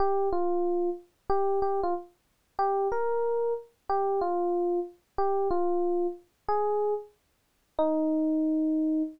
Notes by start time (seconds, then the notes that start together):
0.00 G4
0.32 F4
1.30 G4
1.62 G4
1.83 F4
2.59 G4
2.92 A#4
3.89 G4
4.21 F4
5.18 G4
5.51 F4
6.49 G#4
7.79 D#4